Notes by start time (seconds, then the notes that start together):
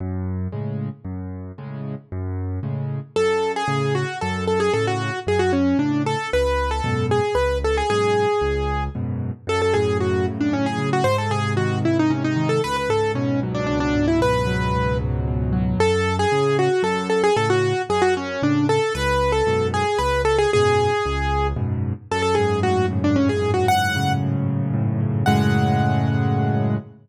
0.00 F#2
0.52 A2 C#3 G#3
1.04 F#2
1.58 A2 C#3 G#3
2.12 F#2
2.63 A2 C#3 G#3
3.16 F#2 A4
3.56 G#4
3.68 A2 C#3
3.95 F#4
4.21 F#2 A4
4.47 A4
4.60 G#4
4.73 A2 C#3 A4
4.87 F#4
5.27 F#2 G#4
5.39 F#4
5.53 C#4
5.79 A2 C#3 D4
6.06 A4
6.33 C#2 B4
6.71 A4
6.84 F#2 G#2 B2
7.11 G#4
7.35 C#2 B4
7.64 A4
7.77 G#4
7.90 F#2 G#2 B2 G#4
8.41 C#2
8.95 F#2 G#2 B2
9.47 F#2 A4
9.62 A4
9.74 A2 G#4
10.00 C#3 F#4
10.28 F#2
10.41 D4
10.53 A2 C#4
10.66 G#4
10.78 C#3
10.93 F#4
11.04 G#2 C5
11.18 A4
11.30 C3 G#4
11.57 D#3 F#4
11.84 G#2 E4
11.99 D#4
12.10 C3 C#4
12.24 D#4
12.36 D#3
12.49 A4
12.64 C#2 B4
12.76 B4
12.89 G#2 A4
13.15 B2 C#4
13.43 F#3
13.54 D4
13.67 C#2 D4
13.80 D4
13.95 G#2
14.08 E4
14.20 B2 B4
14.47 F#3
14.74 C#2
15.00 G#2
15.28 B2
15.53 F#3
15.78 F#2 A4
16.19 G#4
16.32 A2 C#3
16.59 F#4
16.82 F#2 A4
17.10 A4
17.24 G#4
17.36 A2 C#3 A4
17.50 F#4
17.89 F#2 G#4
18.02 F#4
18.17 C#4
18.42 A2 C#3 D4
18.69 A4
18.95 C#2 B4
19.32 A4
19.47 F#2 G#2 B2
19.74 G#4
19.98 C#2 B4
20.25 A4
20.38 G#4
20.53 F#2 G#2 B2 G#4
21.06 C#2
21.56 F#2 G#2 B2
22.11 F#2 A4
22.22 A4
22.35 G#2 G#4
22.63 A2 F#4
22.91 C#3
23.04 D4
23.16 F#2 C#4
23.29 G#4
23.42 G#2
23.54 F#4
23.67 A2 F#5
23.96 C#3
24.23 F#2
24.49 G#2
24.74 A2
25.00 C#3
25.26 F#2 A2 C#3 G#3 F#5